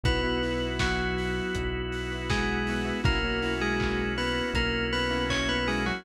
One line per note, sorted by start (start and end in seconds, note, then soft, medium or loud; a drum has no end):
0.04 1.42 B1 medium
0.04 3.02 B3 medium
0.04 0.20 B3 loud
0.04 0.66 B3 medium
0.04 3.02 E4 medium
0.04 0.20 E4 loud
0.04 3.02 F#4 medium
0.04 0.20 F#4 loud
0.04 0.66 B4 medium
0.04 kick loud
0.04 closed hi-hat loud
0.23 0.38 B3 loud
0.23 0.38 E4 loud
0.23 0.38 F#4 medium
0.43 1.03 B3 medium
0.43 1.03 E4 loud
0.43 1.03 F#4 loud
0.43 open hi-hat medium
0.79 2.27 F#3 medium
0.79 2.27 F#4 medium
0.79 kick medium
0.79 snare loud
1.18 open hi-hat medium
1.55 2.93 B1 medium
1.55 kick medium
1.55 closed hi-hat loud
1.92 open hi-hat medium
2.12 2.57 B3 medium
2.12 2.57 E4 medium
2.12 2.57 F#4 medium
2.30 2.97 G#3 medium
2.30 2.97 G#4 medium
2.30 kick medium
2.30 snare loud
2.67 2.84 B3 loud
2.67 2.84 E4 medium
2.67 2.84 F#4 loud
2.67 open hi-hat medium
2.85 3.00 B3 loud
2.85 3.00 E4 loud
2.85 3.00 F#4 loud
3.04 4.42 B1 medium
3.04 3.19 A#3 loud
3.04 3.54 A#3 medium
3.04 6.03 A#3 medium
3.04 3.19 C#4 loud
3.04 6.03 C#4 medium
3.04 3.19 E4 loud
3.04 6.03 E4 medium
3.04 3.19 F#4 loud
3.04 6.03 F#4 medium
3.04 3.54 A#4 medium
3.04 kick loud
3.04 closed hi-hat medium
3.24 3.39 A#3 loud
3.24 3.39 C#4 loud
3.24 3.39 E4 medium
3.24 3.39 F#4 loud
3.42 4.03 A#3 loud
3.42 4.03 C#4 loud
3.42 4.03 E4 loud
3.42 4.03 F#4 loud
3.42 open hi-hat medium
3.61 4.12 G#3 medium
3.61 4.12 G#4 medium
3.80 kick medium
3.80 clap loud
4.18 4.48 B3 medium
4.18 4.48 B4 medium
4.18 open hi-hat medium
4.54 5.92 B1 medium
4.54 4.86 A#3 medium
4.54 4.86 A#4 medium
4.54 kick medium
4.54 closed hi-hat loud
4.93 5.24 B3 medium
4.93 5.24 B4 medium
4.93 open hi-hat medium
5.11 5.56 A#3 loud
5.11 5.56 C#4 medium
5.11 5.56 E4 loud
5.11 5.56 F#4 medium
5.30 5.48 C#4 medium
5.30 5.48 C#5 medium
5.30 kick medium
5.30 clap loud
5.49 5.67 B3 medium
5.49 5.67 B4 medium
5.68 5.85 G#3 medium
5.68 5.83 A#3 loud
5.68 5.83 C#4 medium
5.68 5.83 E4 loud
5.68 5.83 F#4 loud
5.68 5.85 G#4 medium
5.68 open hi-hat medium
5.86 6.04 F#3 medium
5.86 6.02 A#3 medium
5.86 6.02 C#4 loud
5.86 6.02 E4 medium
5.86 6.04 F#4 medium
5.86 6.02 F#4 medium